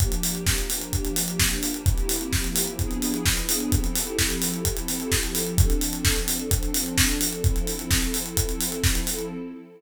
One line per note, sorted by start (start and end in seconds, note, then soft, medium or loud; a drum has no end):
0.00 1.84 F3 medium
0.00 1.84 A#3 medium
0.00 1.84 D4 medium
0.00 1.84 G4 medium
0.00 kick medium
0.00 closed hi-hat medium
0.12 closed hi-hat medium
0.23 open hi-hat medium
0.35 closed hi-hat medium
0.47 kick medium
0.47 snare medium
0.58 closed hi-hat medium
0.70 open hi-hat medium
0.81 closed hi-hat medium
0.93 kick medium
0.93 closed hi-hat medium
1.05 closed hi-hat medium
1.16 open hi-hat medium
1.28 closed hi-hat medium
1.39 kick medium
1.39 snare loud
1.51 closed hi-hat medium
1.63 open hi-hat medium
1.74 closed hi-hat medium
1.86 2.77 F3 medium
1.86 2.79 A#3 medium
1.86 2.79 C4 medium
1.86 2.77 E4 medium
1.86 2.79 G4 medium
1.86 kick medium
1.86 closed hi-hat medium
1.98 closed hi-hat medium
2.09 open hi-hat medium
2.21 closed hi-hat medium
2.33 kick medium
2.33 snare medium
2.44 closed hi-hat medium
2.56 open hi-hat medium
2.67 closed hi-hat medium
2.78 3.70 F3 medium
2.78 3.70 B3 medium
2.78 3.70 D4 medium
2.78 3.70 E4 medium
2.78 3.70 G#4 medium
2.78 kick medium
2.78 closed hi-hat medium
2.91 closed hi-hat medium
3.02 open hi-hat medium
3.14 closed hi-hat medium
3.26 kick medium
3.26 snare loud
3.37 closed hi-hat medium
3.49 open hi-hat medium
3.60 closed hi-hat medium
3.72 5.57 F3 medium
3.72 5.57 C4 medium
3.72 5.57 E4 medium
3.72 5.57 G4 medium
3.72 5.57 A4 medium
3.72 kick medium
3.72 closed hi-hat medium
3.84 closed hi-hat medium
3.96 open hi-hat medium
4.07 closed hi-hat medium
4.19 kick medium
4.19 snare medium
4.30 closed hi-hat medium
4.42 open hi-hat medium
4.54 closed hi-hat medium
4.65 kick medium
4.65 closed hi-hat loud
4.77 closed hi-hat medium
4.88 open hi-hat medium
5.00 closed hi-hat medium
5.12 kick medium
5.12 snare medium
5.23 closed hi-hat medium
5.35 open hi-hat medium
5.47 closed hi-hat medium
5.58 7.42 F3 medium
5.58 7.42 C4 medium
5.58 7.42 D4 loud
5.58 7.42 A4 medium
5.58 kick loud
5.58 closed hi-hat loud
5.70 closed hi-hat medium
5.81 open hi-hat medium
5.93 closed hi-hat medium
6.05 kick medium
6.05 snare loud
6.16 closed hi-hat medium
6.28 open hi-hat medium
6.40 closed hi-hat medium
6.51 kick medium
6.51 closed hi-hat loud
6.63 closed hi-hat medium
6.74 open hi-hat medium
6.86 closed hi-hat medium
6.98 kick medium
6.98 snare loud
7.09 closed hi-hat medium
7.21 open hi-hat medium
7.33 closed hi-hat medium
7.44 9.30 F3 medium
7.44 9.30 C4 medium
7.44 9.30 E4 medium
7.44 9.30 A4 medium
7.44 kick medium
7.44 closed hi-hat medium
7.56 closed hi-hat medium
7.67 open hi-hat medium
7.79 closed hi-hat medium
7.91 kick medium
7.91 snare medium
8.02 closed hi-hat medium
8.14 open hi-hat medium
8.26 closed hi-hat medium
8.37 kick medium
8.37 closed hi-hat loud
8.49 closed hi-hat medium
8.61 open hi-hat medium
8.72 closed hi-hat medium
8.84 kick medium
8.84 snare medium
8.95 closed hi-hat medium
9.07 open hi-hat medium
9.19 closed hi-hat medium